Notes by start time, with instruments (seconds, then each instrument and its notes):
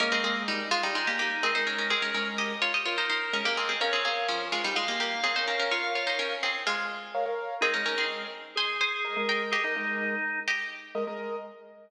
0.00 acoustic grand piano G#3 A#4 D#5, drawbar organ A#3, pizzicato strings C#4 A#4
0.12 acoustic grand piano G#3 A#4 D#5, pizzicato strings C4 G#4
0.24 acoustic grand piano G#3 A#4 D#5, pizzicato strings C4 G#4
0.48 pizzicato strings G3 D#4
0.71 pizzicato strings G#3 F4
0.83 pizzicato strings G3 D#4
0.95 pizzicato strings G#3 F4, drawbar organ D#4
1.07 pizzicato strings A#3 G4
1.19 pizzicato strings A#3 G4
1.43 acoustic grand piano G#3 A#4 D#5, pizzicato strings C4 G#4
1.55 acoustic grand piano G#3 A#4 D#5, pizzicato strings D#4 C5
1.67 pizzicato strings C#4 A#4
1.78 pizzicato strings C#4 A#4
1.90 pizzicato strings C4 G#4, drawbar organ A#4
2.02 acoustic grand piano G#3 A#4 D#5, pizzicato strings C#4 A#4
2.14 acoustic grand piano G#3 A#4 D#5, pizzicato strings C#4 A#4
2.38 pizzicato strings G4 D#5
2.62 pizzicato strings F4 C#5
2.74 pizzicato strings G4 D#5
2.86 pizzicato strings F4 C#5, drawbar organ A#4
2.98 pizzicato strings D#4 C5
3.10 pizzicato strings D#4 C5
3.33 acoustic grand piano G#3 A#4 D#5, pizzicato strings C#4 A#4
3.45 acoustic grand piano G#3 A#4 D#5, pizzicato strings A#3 G4
3.57 pizzicato strings C4 G#4
3.69 pizzicato strings C4 G#4
3.80 pizzicato strings C#4 A#4, acoustic grand piano A#4 C#5 F5, drawbar organ C#5
3.93 pizzicato strings C4 G#4, acoustic grand piano A#4 C#5 F5
4.05 pizzicato strings C4 G#4, acoustic grand piano A#4 C#5 F5
4.28 pizzicato strings F3 C#4
4.52 pizzicato strings G#3 F4
4.64 pizzicato strings G3 D#4
4.75 pizzicato strings G#3 F4, drawbar organ F5
4.88 pizzicato strings A#3 G4
5.00 pizzicato strings A#3 G4
5.23 pizzicato strings C4 G#4, acoustic grand piano A#4 C#5 F5
5.36 pizzicato strings D#4 C5, acoustic grand piano A#4 C#5 F5
5.48 pizzicato strings C#4 A#4
5.60 pizzicato strings C#4 A#4
5.71 pizzicato strings F4 C#5, drawbar organ F5
5.84 acoustic grand piano A#4 C#5 F5
5.95 pizzicato strings F4 C#5, acoustic grand piano A#4 C#5 F5
6.07 pizzicato strings D#4 C5
6.19 pizzicato strings C#4 A#4
6.43 pizzicato strings C4 G#4
6.67 pizzicato strings G#3 F4
7.15 acoustic grand piano A#4 C#5 F5
7.26 acoustic grand piano A#4 C#5 F5
7.61 acoustic grand piano G#3 A#4 D#5, pizzicato strings C4 G#4, drawbar organ D#4
7.74 acoustic grand piano G#3 A#4 D#5, pizzicato strings C#4 A#4
7.86 acoustic grand piano G#3 A#4 D#5, pizzicato strings C#4 A#4
7.98 pizzicato strings C4 G#4
8.56 drawbar organ G#4, pizzicato strings C5 G#5
8.81 pizzicato strings C5 G#5
9.05 acoustic grand piano G#3 A#4 D#5
9.17 acoustic grand piano G#3 A#4 D#5
9.29 pizzicato strings A#4 G5
9.51 pizzicato strings G4 D#5, drawbar organ G#4
9.64 acoustic grand piano G#3 A#4 D#5, drawbar organ D#4
9.76 acoustic grand piano G#3 A#4 D#5, drawbar organ D#4
10.48 pizzicato strings G4 D#5
10.95 acoustic grand piano G#3 A#4 D#5
11.07 acoustic grand piano G#3 A#4 D#5